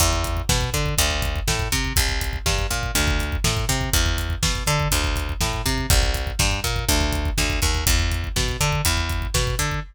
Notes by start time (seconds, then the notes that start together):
0.00 E2, kick, closed hi-hat
0.13 kick
0.24 kick, closed hi-hat
0.37 kick
0.49 B2, kick, snare
0.61 kick
0.74 D3, kick, closed hi-hat
0.86 kick
0.98 D2, kick, closed hi-hat
1.11 kick
1.22 kick, closed hi-hat
1.36 kick
1.48 A2, kick, snare
1.59 kick
1.72 C3, kick, snare, closed hi-hat
1.84 kick
1.96 C2, kick, closed hi-hat
2.09 kick
2.21 kick, closed hi-hat
2.33 kick
2.46 G2, kick, snare
2.58 kick
2.70 A#2, kick, closed hi-hat
2.83 kick
2.95 D2, kick, closed hi-hat
3.07 kick
3.19 kick, closed hi-hat
3.32 kick
3.44 A2, kick, snare
3.57 kick
3.69 C3, kick, snare, closed hi-hat
3.81 kick
3.93 E2, kick, closed hi-hat
4.06 kick
4.18 kick, closed hi-hat
4.30 kick
4.43 B2, kick, snare
4.55 kick
4.67 D3, kick, closed hi-hat
4.80 kick
4.91 D2, kick, closed hi-hat
5.04 kick
5.16 kick, closed hi-hat
5.29 kick
5.41 A2, kick, snare
5.53 kick
5.66 C3, kick, snare, closed hi-hat
5.78 kick
5.90 C2, kick, closed hi-hat
6.03 kick
6.14 kick, closed hi-hat
6.27 kick
6.39 G2, kick, snare
6.51 kick
6.64 A#2, kick, closed hi-hat
6.76 kick
6.89 D2, kick, closed hi-hat
7.01 kick
7.12 kick, closed hi-hat
7.25 kick
7.38 D2, kick, snare
7.50 kick
7.62 D#2, kick, snare, closed hi-hat
7.74 kick
7.87 E2, kick, closed hi-hat
7.99 kick
8.11 kick, closed hi-hat
8.24 kick
8.36 B2, kick, snare
8.48 kick
8.60 D3, kick, closed hi-hat
8.72 kick
8.85 E2, kick, closed hi-hat
8.97 kick
9.09 kick, closed hi-hat
9.22 kick
9.34 B2, kick, snare
9.47 kick
9.59 D3, kick, snare, closed hi-hat
9.71 kick